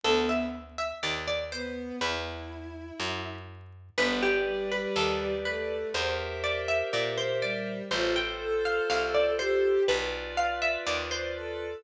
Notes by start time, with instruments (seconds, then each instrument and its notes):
0.03 electric bass (finger) D2, violin B3, harpsichord A4
0.29 harpsichord E5
0.78 harpsichord E5
1.03 electric bass (finger) D#2, harpsichord D5
1.28 harpsichord D5
1.52 violin B3, harpsichord C5
2.00 electric bass (finger) E2, violin E4, harpsichord B4
3.00 electric bass (finger) F#2
3.98 electric bass (finger) G1, violin B3, electric piano 2 G4 B4 D5, harpsichord B4
4.23 harpsichord G4
4.46 violin G3
4.70 violin G3, harpsichord B4
4.96 electric bass (finger) D#2, harpsichord A4
5.45 violin A3, harpsichord B4
5.94 electric bass (finger) E2, electric piano 2 G4 A#4 C5 E5, harpsichord C5
6.44 harpsichord D5
6.68 harpsichord E5
6.93 electric bass (finger) A#2, harpsichord D5
7.18 harpsichord C5
7.42 violin G3, harpsichord D5
7.91 electric bass (finger) A1, violin F4, electric piano 2 F4 A4 C5, harpsichord C5
8.16 harpsichord G5
8.40 violin A4
8.65 violin A4, harpsichord F5
8.90 electric bass (finger) C2, harpsichord F5
9.15 harpsichord D5
9.39 violin G4, harpsichord C5
9.88 electric bass (finger) B1, electric piano 2 F4 B4 D5, harpsichord B4
10.37 harpsichord F5
10.62 harpsichord E5
10.87 electric bass (finger) D#2, harpsichord D5
11.11 harpsichord C5
11.35 violin A4